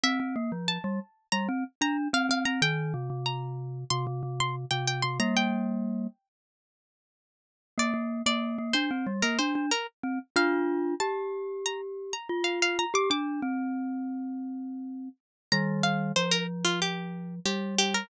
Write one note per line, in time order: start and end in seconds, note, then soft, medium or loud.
0.03 0.19 C4 medium
0.03 0.67 E5 medium
0.20 0.35 C4 medium
0.36 0.51 A#3 medium
0.52 0.78 F3 medium
0.68 1.27 A5 medium
0.84 0.99 G3 medium
1.32 1.48 G3 medium
1.32 1.47 A#5 medium
1.49 1.64 C4 medium
1.81 2.08 D4 loud
1.81 1.97 A#5 medium
2.13 2.29 C4 medium
2.13 2.29 F5 medium
2.29 2.45 C4 medium
2.29 2.46 F5 medium
2.45 2.61 C4 medium
2.45 2.61 A#5 medium
2.62 2.93 D#3 loud
2.62 3.19 G5 loud
2.94 3.09 C3 medium
3.10 3.84 C3 medium
3.26 3.79 A#5 medium
3.90 4.06 C3 loud
3.90 4.06 C6 medium
4.07 4.22 C3 medium
4.23 4.65 C3 medium
4.40 4.56 C6 medium
4.71 5.02 C3 medium
4.71 4.86 G5 medium
4.87 5.03 G5 medium
5.02 5.19 C3 medium
5.02 5.18 C6 medium
5.20 6.07 G3 medium
5.20 6.07 A#3 medium
5.20 5.35 A#5 loud
5.37 6.27 G5 medium
7.78 7.93 A#3 loud
7.78 8.21 D5 loud
7.94 8.22 A#3 medium
8.26 8.57 A#3 medium
8.26 8.70 D5 medium
8.58 8.74 A#3 medium
8.73 8.90 D4 medium
8.73 9.13 C5 medium
8.91 9.06 C4 medium
9.07 9.22 G3 medium
9.22 9.38 A#3 medium
9.22 9.38 A#4 medium
9.39 9.54 D4 medium
9.39 9.66 C5 medium
9.55 9.71 D4 medium
9.71 9.87 A#4 medium
10.03 10.19 C4 medium
10.36 10.95 D4 medium
10.36 10.95 F4 loud
10.36 10.94 F5 loud
11.00 12.13 G4 medium
11.00 11.60 A5 medium
11.66 11.81 A#5 medium
12.13 12.28 A#5 medium
12.29 12.85 F4 medium
12.44 12.59 F5 medium
12.62 12.78 F5 medium
12.79 12.94 A#5 medium
12.94 13.09 G4 loud
12.94 13.10 D6 loud
13.10 13.41 D4 medium
13.10 14.51 D6 loud
13.42 15.09 C4 medium
15.52 16.12 D#3 medium
15.52 16.12 G3 medium
15.52 15.80 A#5 loud
15.83 16.12 F5 medium
16.16 17.40 F3 medium
16.16 16.31 C5 medium
16.31 16.47 A#4 loud
16.65 16.80 F4 medium
16.82 17.35 G4 medium
17.45 18.03 G3 medium
17.45 17.75 G4 medium
17.78 17.94 G4 loud
17.94 18.09 A#4 medium